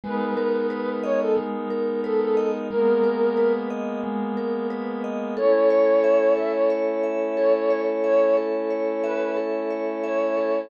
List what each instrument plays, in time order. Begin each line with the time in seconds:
0.03 pad 2 (warm) G#3 B3 D#4 A#4, vibraphone G#3, flute B4
0.37 vibraphone A#4
0.70 vibraphone B4
1.03 flute C#5, vibraphone D#5
1.21 flute A4
1.37 vibraphone G#3
1.70 vibraphone A#4
2.04 flute A4, vibraphone B4
2.20 flute A4
2.37 vibraphone D#5
2.70 vibraphone G#3, pad 2 (warm) G#3 A#3 B3 A#4, flute A#4
3.04 vibraphone A#4
3.37 vibraphone B4
3.70 vibraphone D#5
4.04 vibraphone G#3
4.37 vibraphone A#4
4.70 vibraphone B4
5.04 vibraphone D#5
5.37 pad 2 (warm) A3 C#4 E4, vibraphone A4, flute C#5
5.70 vibraphone C#5
6.04 vibraphone E5
6.37 vibraphone A4, flute E5
6.53 flute C#5
6.70 vibraphone C#5
7.03 vibraphone E5
7.37 vibraphone A4, flute C#5
7.54 flute C#5
7.70 vibraphone C#5
8.04 flute C#5, vibraphone E5
8.37 vibraphone A4
8.70 vibraphone C#5
9.04 flute B4, vibraphone E5
9.37 vibraphone A4
9.71 vibraphone C#5
10.04 flute C#5, vibraphone E5
10.37 vibraphone A4